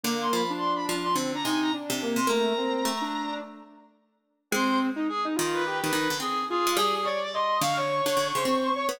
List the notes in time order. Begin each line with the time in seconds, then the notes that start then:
0.04 D3 A#3 D6
0.21 C6
0.33 F3 B5
0.50 D4
0.58 C6
0.75 B5
0.89 F3
1.04 C6
1.15 D3 C4
1.34 D4 A#5
1.44 C3 D#4 G#5
1.62 A#5
1.74 D4
1.90 C3
2.02 A#3
2.16 C3 C6
2.27 A3 A#3 A#5
2.57 C4
2.85 A3
3.01 D4
4.51 G#3 C4 C5
4.96 D#4
5.09 G#4
5.25 D#4
5.35 D#3 F4
5.54 B4
5.66 G4
5.82 D#3 B4
5.93 D#3
6.10 D3
6.20 C4 G#4
6.50 F4 G#4
6.67 G#3
6.77 G3 G#4
6.94 G#4
7.03 C#5 D5
7.24 D5
7.33 D#5 C6
7.61 D3 F5 C#6
7.76 C#5
8.06 D3
8.17 D3
8.35 C#3 C5
8.45 C4
8.76 C#5
8.89 B3